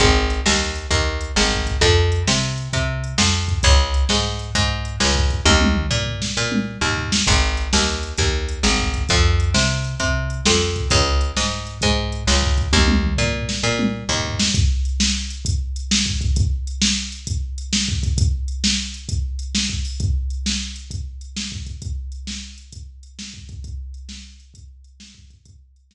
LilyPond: <<
  \new Staff \with { instrumentName = "Electric Bass (finger)" } { \clef bass \time 4/4 \key aes \major \tempo 4 = 132 aes,,4 ees,4 ees,4 aes,,4 | f,4 c4 c4 f,4 | des,4 aes,4 aes,4 des,4 | ees,4 bes,4 bes,4 ees,4 |
aes,,4 ees,4 ees,4 aes,,4 | f,4 c4 c4 f,4 | des,4 aes,4 aes,4 des,4 | ees,4 bes,4 bes,4 ees,4 |
r1 | r1 | r1 | r1 |
r1 | r1 | r1 | }
  \new DrumStaff \with { instrumentName = "Drums" } \drummode { \time 4/4 \tuplet 3/2 { <hh bd>8 r8 hh8 sn8 r8 hh8 <hh bd>8 r8 hh8 sn8 bd8 <hh bd>8 } | \tuplet 3/2 { <hh bd>8 r8 hh8 sn8 r8 hh8 <hh bd>8 r8 hh8 sn8 r8 <bd hh>8 } | \tuplet 3/2 { <hh bd>8 r8 hh8 sn8 r8 hh8 <hh bd>8 r8 hh8 sn8 bd8 <hh bd>8 } | \tuplet 3/2 { <bd tommh>8 tommh8 toml8 tomfh8 tomfh8 sn8 r8 tommh8 r8 tomfh8 tomfh8 sn8 } |
\tuplet 3/2 { <hh bd>8 r8 hh8 sn8 r8 hh8 <hh bd>8 r8 hh8 sn8 bd8 <hh bd>8 } | \tuplet 3/2 { <hh bd>8 r8 hh8 sn8 r8 hh8 <hh bd>8 r8 hh8 sn8 r8 <bd hh>8 } | \tuplet 3/2 { <hh bd>8 r8 hh8 sn8 r8 hh8 <hh bd>8 r8 hh8 sn8 bd8 <hh bd>8 } | \tuplet 3/2 { <bd tommh>8 tommh8 toml8 tomfh8 tomfh8 sn8 r8 tommh8 r8 tomfh8 tomfh8 sn8 } |
\tuplet 3/2 { <hh bd>8 r8 hh8 sn8 r8 hh8 <hh bd>8 r8 hh8 sn8 bd8 <hh bd>8 } | \tuplet 3/2 { <hh bd>8 r8 hh8 sn8 r8 hh8 <hh bd>8 r8 hh8 sn8 bd8 <hh bd>8 } | \tuplet 3/2 { <hh bd>8 r8 hh8 sn8 r8 hh8 <hh bd>8 r8 hh8 sn8 bd8 hho8 } | \tuplet 3/2 { <hh bd>8 r8 hh8 sn8 r8 hh8 <hh bd>8 r8 hh8 sn8 bd8 <hh bd>8 } |
\tuplet 3/2 { <hh bd>8 r8 hh8 sn8 r8 hh8 <hh bd>8 r8 hh8 sn8 bd8 <hh bd>8 } | \tuplet 3/2 { <hh bd>8 r8 hh8 sn8 r8 hh8 <hh bd>8 r8 hh8 sn8 bd8 <hh bd>8 } | \tuplet 3/2 { <hh bd>8 r8 hh8 } sn4 r4 r4 | }
>>